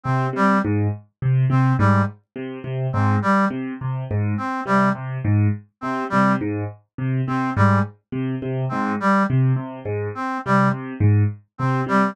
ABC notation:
X:1
M:7/8
L:1/8
Q:1/4=104
K:none
V:1 name="Acoustic Grand Piano" clef=bass
C, C, _A,, z C, C, A,, | z C, C, _A,, z C, C, | _A,, z C, C, A,, z C, | C, _A,, z C, C, A,, z |
C, C, _A,, z C, C, A,, | z C, C, _A,, z C, C, |]
V:2 name="Brass Section"
C G, z3 C G, | z3 C G, z2 | z C G, z3 C | G, z3 C G, z |
z2 C G, z3 | C G, z3 C G, |]